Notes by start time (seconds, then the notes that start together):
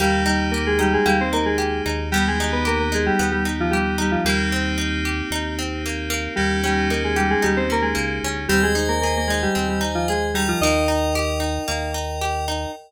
0.00 D#2 G3 A#3 D#4 G4
0.26 G3 D#4 G4
0.51 A#3 G4 A#4
0.67 G#3 G#4
0.79 G3 D#4 G4
0.93 G#3 G#4
1.05 D#2 G3 A#3 G4
1.21 C4 C5
1.33 A#3 D#4 A#4
1.45 G#3 G#4
1.58 G4
1.86 D#2 D#4
2.12 G3 B3 D#4 G4
2.28 G#3 G#4
2.40 D#4
2.52 B3 B4
2.65 A#3 G4 A#4
2.80 A#3 A#4
2.92 G#3 D#4 G#4
3.06 G3 G4
3.19 D#2 B3
3.32 G3 G4
3.45 D#4
3.60 F3 F4
3.71 G3 G4
3.98 G3 D#4 G4
4.12 F3 F4
4.25 D#2 G3 A#3 C4 D#4 G4
4.52 C4
4.78 D#4
5.05 G4
5.31 D#2 D#4
5.59 C4
5.86 A#3
6.10 A#3
6.36 D#2 G3 A#3 C#4 D#4 G4
6.64 G3 C#4 G4
6.90 A#3 D#4 A#4
7.04 G#3 G#4
7.16 G3 G4
7.30 G#3 G#4
7.42 D#2 G3 D#4 G4
7.57 C4 C5
7.70 A#3 C#4 A#4
7.82 G#3 G#4
7.95 C#2 A#3
8.23 D2 C#4
8.48 D#2 G3 C4 G4 C5 D#5 G#5
8.63 G#3 G#4
8.75 D#4
8.88 A#3 A#4
9.02 A#3 G#4 A#4
9.17 A#3 A#4
9.27 G#3 D#4 G#4
9.42 G3 G4
9.55 D#2 C4
9.69 G3 G4
9.81 D#4
9.95 F3 F4
10.08 G#3 G#4
10.34 G3 D#4 G4 A#4 D#5 G5
10.48 F3 F4
10.61 D#2 A#3 D#4 D#5
10.88 D#4
11.15 G4
11.40 D#4
11.68 D#2 A#3
11.94 D#4
12.21 G4
12.48 D#4